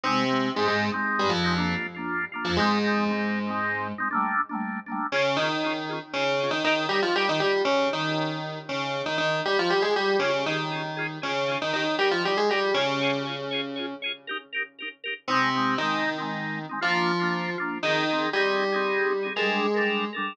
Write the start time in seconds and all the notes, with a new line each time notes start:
0.03 C3 G#3 C4 D#4
0.28 G#3 C4 D#4
0.55 G#2 G#3 C4 D#4
0.67 G#2 G#3
0.92 G#3 C4 D#4
1.19 G2 G3
1.29 F2 F3
1.44 G#3 C4 D#4
1.56 A#3 D4 F4
1.95 A#3 D4 F4
2.32 A#3 D4 F4
2.45 F2 F3
2.57 G#2 G#3 C4 D#4
2.62 G#3
2.84 G#3 C4 D#4
3.09 G#3 C4 D#4
3.47 G#3 C4 D#4
3.98 G#3 C4 D#4
4.11 A3 A#3 D4
4.16 G3
4.49 A3 A#3 D4
4.55 G3
4.86 A3 A#3 D4
4.92 G3
5.12 C#3 C#4 F4 G#4
5.37 D#3 D#4 F4 G#4
5.42 C#4
5.63 C#4 F4 G#4
5.89 C#4 F4 G#4
6.13 C#3 C#4 F4 G#4
6.40 C#4 F4 G#4
6.51 D#3 D#4
6.64 D#3 D#4 G4 A#4
6.69 D#4
6.89 G3 G4 A#4
6.93 D#4
7.02 F3 F4
7.15 G3 G4 A#4
7.20 D#4
7.29 D#3 D#4
7.40 G3 G4 A#4
7.45 D#4
7.65 C#3 C#4
7.93 D#3 D#4
8.69 C#3 C#4
9.06 D#3 D#4
9.18 D#3 D#4
9.45 G3 G4
9.59 F3 F4
9.70 G3 G4
9.82 G#3 G#4
9.96 G3 G4
10.19 C#3 C#4 F4 G#4
10.24 C#4
10.46 D#3 D#4 F4 G#4
10.50 C#4
10.72 C#4 F4 G#4
10.97 C#4 F4 G#4
11.22 C#3 C#4 F4 G#4
11.48 C#4 F4 G#4
11.62 D#3 D#4
11.73 D#3 D#4 G4 A#4
11.99 G3 D#4 G4 A#4
12.11 F3 F4
12.24 G3 D#4 G4 A#4
12.37 G#3 G#4
12.49 G3 D#4 G4 A#4
12.74 C#3 C#4 F4 G#4 C#5
13.01 F4 G#4 C#5
13.25 F4 G#4 C#5
13.51 F4 G#4 C#5
13.76 F4 G#4 C#5
14.02 F4 G#4 C#5
14.27 D#4 G4 A#4
14.53 D#4 G4 A#4
14.79 D#4 G4 A#4
15.04 D#4 G4 A#4
15.28 C3 C4 D#4
15.33 G#3
15.54 G#3 C4 D#4
15.78 D#3 C4 D#4
15.83 G#3
16.18 G#3 C4 D#4
16.69 G#3 C4 D#4
16.81 F3 A#3 D4 F4
17.20 A#3 D4 F4
17.58 A#3 D4 F4
17.83 D#3 D#4 G#4
17.87 C4
18.09 C4 D#4 G#4
18.33 G3 D#4 G4 G#4
18.37 C4
18.72 C4 D#4 G#4
19.23 C4 D#4 G#4
19.36 G#3 D4 G#4 A4 A#4
19.41 G3
19.74 D4 A4 A#4
19.80 G3
20.13 D4 A4 A#4
20.18 G3